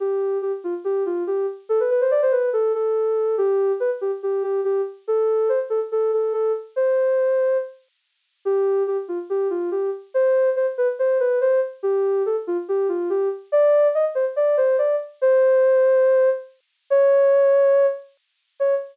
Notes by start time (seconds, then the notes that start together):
0.00 G4
0.42 G4
0.64 F4
0.84 G4
1.06 F4
1.27 G4
1.69 A4
1.80 B4
1.90 B4
2.01 C5
2.11 D5
2.22 C5
2.32 B4
2.53 A4
2.74 A4
3.38 G4
3.80 B4
4.01 G4
4.23 G4
4.43 G4
4.64 G4
5.08 A4
5.49 C5
5.70 A4
5.92 A4
6.13 A4
6.33 A4
6.76 C5
8.45 G4
8.87 G4
9.08 F4
9.30 G4
9.50 F4
9.71 G4
10.14 C5
10.56 C5
10.78 B4
10.99 C5
11.20 B4
11.41 C5
11.83 G4
12.26 A4
12.47 F4
12.68 G4
12.89 F4
13.10 G4
13.52 D5
13.95 D#5
14.15 C5
14.36 D5
14.57 C5
14.78 D5
15.21 C5
16.90 C#5
18.60 C#5